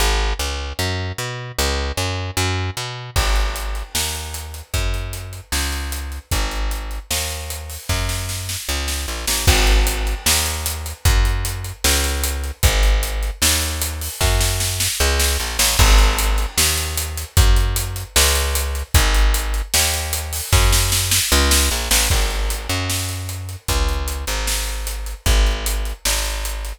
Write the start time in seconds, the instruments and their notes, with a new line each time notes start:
0.00 electric bass (finger) G#1
0.39 electric bass (finger) C#2
0.79 electric bass (finger) F#2
1.18 electric bass (finger) B2
1.58 electric bass (finger) C#2
1.97 electric bass (finger) F#2
2.37 electric bass (finger) F#2
2.77 electric bass (finger) B2
3.16 electric bass (finger) G#1, kick, crash
3.36 closed hi-hat
3.56 closed hi-hat
3.75 closed hi-hat
3.95 electric bass (finger) D#2, snare
4.15 closed hi-hat
4.34 closed hi-hat
4.54 closed hi-hat
4.74 electric bass (finger) F#2, kick, closed hi-hat
4.94 closed hi-hat
5.13 closed hi-hat
5.33 closed hi-hat
5.52 electric bass (finger) C#2, snare
5.72 closed hi-hat
5.92 closed hi-hat
6.12 closed hi-hat
6.31 electric bass (finger) G#1, kick, closed hi-hat
6.51 closed hi-hat
6.71 closed hi-hat
6.91 closed hi-hat
7.11 electric bass (finger) D#2, snare
7.31 closed hi-hat
7.50 closed hi-hat
7.70 open hi-hat
7.89 electric bass (finger) F#2, kick, snare
8.09 snare
8.29 snare
8.49 snare
8.69 electric bass (finger) C#2
8.88 snare
9.08 electric bass (finger) A#1
9.27 electric bass (finger) A1, snare
9.47 electric bass (finger) G#1, kick, crash
9.67 closed hi-hat
9.87 closed hi-hat
10.07 closed hi-hat
10.26 electric bass (finger) D#2, snare
10.46 closed hi-hat
10.66 closed hi-hat
10.86 closed hi-hat
11.05 electric bass (finger) F#2, kick, closed hi-hat
11.25 closed hi-hat
11.45 closed hi-hat
11.64 closed hi-hat
11.84 electric bass (finger) C#2, snare
12.04 closed hi-hat
12.24 closed hi-hat
12.44 closed hi-hat
12.63 electric bass (finger) G#1, kick, closed hi-hat
12.83 closed hi-hat
13.03 closed hi-hat
13.23 closed hi-hat
13.42 electric bass (finger) D#2, snare
13.62 closed hi-hat
13.82 closed hi-hat
14.01 open hi-hat
14.21 electric bass (finger) F#2, kick, snare
14.41 snare
14.60 snare
14.80 snare
15.00 electric bass (finger) C#2
15.19 snare
15.40 electric bass (finger) A#1
15.59 electric bass (finger) A1, snare
15.79 electric bass (finger) G#1, kick, crash
15.98 closed hi-hat
16.19 closed hi-hat
16.38 closed hi-hat
16.57 electric bass (finger) D#2, snare
16.78 closed hi-hat
16.97 closed hi-hat
17.17 closed hi-hat
17.37 electric bass (finger) F#2, kick, closed hi-hat
17.56 closed hi-hat
17.76 closed hi-hat
17.96 closed hi-hat
18.16 electric bass (finger) C#2, snare
18.35 closed hi-hat
18.55 closed hi-hat
18.75 closed hi-hat
18.94 electric bass (finger) G#1, kick, closed hi-hat
19.14 closed hi-hat
19.34 closed hi-hat
19.54 closed hi-hat
19.74 electric bass (finger) D#2, snare
19.94 closed hi-hat
20.13 closed hi-hat
20.33 open hi-hat
20.52 electric bass (finger) F#2, kick, snare
20.72 snare
20.92 snare
21.11 snare
21.32 electric bass (finger) C#2
21.51 snare
21.71 electric bass (finger) A#1
21.91 electric bass (finger) A1, snare
22.10 electric bass (finger) G#1, kick, crash
22.30 closed hi-hat
22.50 closed hi-hat
22.69 electric bass (finger) F#2, closed hi-hat
22.90 snare
23.09 closed hi-hat
23.29 closed hi-hat
23.49 closed hi-hat
23.68 electric bass (finger) C#2, kick, closed hi-hat
23.89 closed hi-hat
24.08 closed hi-hat
24.27 electric bass (finger) G#1, closed hi-hat
24.47 snare
24.67 closed hi-hat
24.87 closed hi-hat
25.06 closed hi-hat
25.26 electric bass (finger) G#1, kick, closed hi-hat
25.46 closed hi-hat
25.66 closed hi-hat
25.85 closed hi-hat
26.05 electric bass (finger) G#1, snare
26.25 closed hi-hat
26.45 closed hi-hat
26.65 closed hi-hat